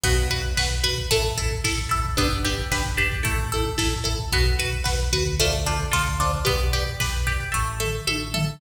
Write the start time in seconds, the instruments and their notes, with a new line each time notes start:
0.04 synth bass 1 B1, pizzicato strings B3, overdriven guitar F#4 B4, kick, crash
0.17 kick, closed hi-hat
0.30 overdriven guitar F#4 B4, pizzicato strings B4, kick, closed hi-hat
0.44 kick, closed hi-hat
0.57 synth bass 1 B1, overdriven guitar F#4 B4, pizzicato strings B4, kick, snare
0.71 kick, closed hi-hat
0.84 overdriven guitar F#4 B4, pizzicato strings B4, kick, closed hi-hat
0.97 kick, closed hi-hat
1.11 synth bass 1 A1, pizzicato strings A3, overdriven guitar E4 A4, kick, closed hi-hat
1.24 kick, closed hi-hat
1.38 overdriven guitar E4 A4, pizzicato strings A4, kick, closed hi-hat
1.51 kick, closed hi-hat
1.64 synth bass 1 A1, overdriven guitar E4 A4, pizzicato strings A4, kick, snare
1.78 kick, closed hi-hat
1.89 overdriven guitar E4 A4, pizzicato strings A4, kick, closed hi-hat
2.05 kick, closed hi-hat
2.17 synth bass 1 G1, pizzicato strings B3, overdriven guitar D4 G4 B4, kick, closed hi-hat
2.31 kick, closed hi-hat
2.45 overdriven guitar D4 G4 B4, pizzicato strings G4, kick, closed hi-hat
2.58 kick, closed hi-hat
2.71 synth bass 1 G1, overdriven guitar D4 G4 B4, pizzicato strings B4, kick, snare
2.85 kick, closed hi-hat
2.97 overdriven guitar D4 G4 B4, pizzicato strings G4, kick, closed hi-hat
3.12 kick, closed hi-hat
3.23 synth bass 1 A1, pizzicato strings A3, overdriven guitar E4 A4, kick, closed hi-hat
3.39 kick, closed hi-hat
3.52 overdriven guitar E4 A4, pizzicato strings A4, kick, closed hi-hat
3.65 kick, closed hi-hat
3.78 synth bass 1 A1, overdriven guitar E4 A4, pizzicato strings A4, kick, snare
3.92 kick, closed hi-hat
4.04 overdriven guitar E4 A4, pizzicato strings A4, kick, closed hi-hat
4.19 kick, closed hi-hat
4.32 synth bass 1 B1, pizzicato strings B3, overdriven guitar F#4 B4, kick, closed hi-hat
4.46 kick, closed hi-hat
4.59 overdriven guitar F#4 B4, pizzicato strings B4, kick, closed hi-hat
4.72 kick, closed hi-hat
4.84 synth bass 1 B1, overdriven guitar F#4 B4, pizzicato strings B4, kick, snare
4.99 kick, closed hi-hat
5.13 synth bass 1 D2, overdriven guitar F#4 B4, pizzicato strings B4, kick, closed hi-hat
5.26 kick, closed hi-hat
5.39 pizzicato strings A3, overdriven guitar F4 A4 C5 D5, kick, closed hi-hat
5.53 kick, closed hi-hat
5.66 pizzicato strings D4, overdriven guitar F4 A4 C5 D5, kick, closed hi-hat
5.80 kick, closed hi-hat
5.92 synth bass 1 D2, overdriven guitar F4 A4 C5 D5, pizzicato strings F4, kick, snare
6.06 kick, closed hi-hat
6.20 pizzicato strings D4, overdriven guitar F4 A4 C5 D5, kick, closed hi-hat
6.33 kick, closed hi-hat
6.45 synth bass 1 B1, pizzicato strings B3, overdriven guitar G4 B4 D5, kick, closed hi-hat
6.60 kick, closed hi-hat
6.73 overdriven guitar G4 B4 D5, pizzicato strings G4, kick, closed hi-hat
6.87 kick, closed hi-hat
7.00 synth bass 1 B1, overdriven guitar G4 B4 D5, pizzicato strings B4, kick, snare
7.14 kick, closed hi-hat
7.27 pizzicato strings G4, overdriven guitar G4 B4 D5, kick, closed hi-hat
7.40 kick, closed hi-hat
7.52 synth bass 1 A1, pizzicato strings A3, overdriven guitar A4 E5, kick
7.80 pizzicato strings A4, overdriven guitar A4 E5, floor tom
8.07 synth bass 1 A1, overdriven guitar A4 E5, pizzicato strings A4, high tom
8.34 overdriven guitar A4 E5, pizzicato strings A4, floor tom